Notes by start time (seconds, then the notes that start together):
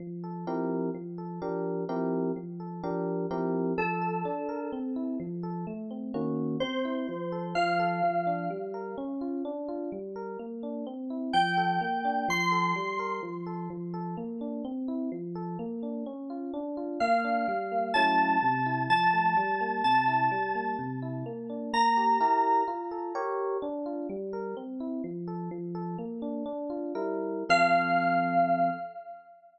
0.00 F3
0.24 A4
0.47 F3 C4 E4 G4 A#4
0.94 F3
1.18 A4
1.42 F3 D4 G4 A#4
1.89 F3 C4 E4 G4 A#4
2.36 F3
2.60 A4
2.83 F3 D4 G4 A#4
3.31 F3 C4 E4 G4 A#4
3.78 F3 A4
4.02 A4
4.25 D4
4.49 A#4
4.72 C4
4.96 E4
5.20 F3
5.43 A4
5.67 A3
5.91 C4
6.14 D#3 A#3 C#4 F#4
6.60 C4 C5
6.85 E4
7.09 F3
7.32 A4
7.55 F3 F5
7.80 A4
8.03 F3
8.27 D4
8.50 G3
8.74 A#4
8.98 C#4
9.21 F4
9.45 D4
9.69 F4
9.92 G3
10.16 A#4
10.39 A#3
10.63 D4
10.87 C4
11.10 E4
11.33 F3 G5
11.57 A4
11.81 A#3
12.05 D4
12.28 F3 C6
12.52 A4
12.76 G3
12.99 A#4
13.23 F3
13.46 A4
13.70 F3
13.94 A4
14.17 A#3
14.41 D4
14.65 C4
14.88 E4
15.12 F3
15.35 A4
15.59 A#3
15.83 D4
16.06 C#4
16.30 F4
16.54 D4
16.77 F4
17.00 A#3 F5
17.24 D4
17.48 G3
17.72 A#3
17.94 F#3 A3 C#4 E4 A5
18.43 C3
18.66 E4
18.90 F3 A5
19.13 A3
19.37 G3
19.61 A#3
19.84 C3 A5
20.08 E4
20.31 G3
20.55 A#3
20.79 C3
21.02 E4
21.26 A#3
21.50 D4
21.73 A#3 A#5
21.97 G4
22.20 E4 G4 A#4
22.68 F4
22.91 A4
23.15 G4 A#4 C#5
23.62 D4
23.86 F4
24.09 G3
24.33 A#4
24.57 C4
24.80 E4
25.04 F3
25.28 A4
25.51 F3
25.75 A4
25.98 A#3
26.22 D4
26.46 D4
26.70 F4
26.95 G3 E4 A#4
27.49 F3 C4 A4 F5